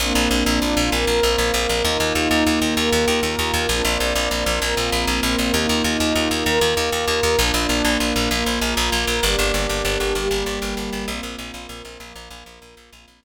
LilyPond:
<<
  \new Staff \with { instrumentName = "Pad 5 (bowed)" } { \time 6/8 \key bes \mixolydian \tempo 4. = 130 <bes c' d' f'>2. | <bes c' f' bes'>2. | <bes ees' f'>2. | <bes f' bes'>2. |
<bes c' d' f'>2. | <bes c' f' bes'>2. | <bes ees' f'>2. | <bes f' bes'>2. |
<bes d' f'>2. | <bes f' bes'>2. | <bes d' g'>2. | <g bes g'>2. |
<bes c' f'>2. | <f bes f'>2. | <bes c' f'>4. r4. | }
  \new Staff \with { instrumentName = "Electric Bass (finger)" } { \clef bass \time 6/8 \key bes \mixolydian bes,,8 bes,,8 bes,,8 bes,,8 bes,,8 bes,,8 | bes,,8 bes,,8 bes,,8 bes,,8 bes,,8 bes,,8 | ees,8 ees,8 ees,8 ees,8 ees,8 ees,8 | ees,8 ees,8 ees,8 ees,8 ees,8 ees,8 |
bes,,8 bes,,8 bes,,8 bes,,8 bes,,8 bes,,8 | bes,,8 bes,,8 bes,,8 bes,,8 bes,,8 bes,,8 | ees,8 ees,8 ees,8 ees,8 ees,8 ees,8 | ees,8 ees,8 ees,8 ees,8 ees,8 ees,8 |
bes,,8 bes,,8 bes,,8 bes,,8 bes,,8 bes,,8 | bes,,8 bes,,8 bes,,8 bes,,8 bes,,8 bes,,8 | g,,8 g,,8 g,,8 g,,8 g,,8 g,,8 | g,,8 g,,8 g,,8 g,,8 g,,8 g,,8 |
bes,,8 bes,,8 bes,,8 bes,,8 bes,,8 bes,,8 | bes,,8 bes,,8 bes,,8 bes,,8 bes,,8 bes,,8 | bes,,8 bes,,8 bes,,8 r4. | }
>>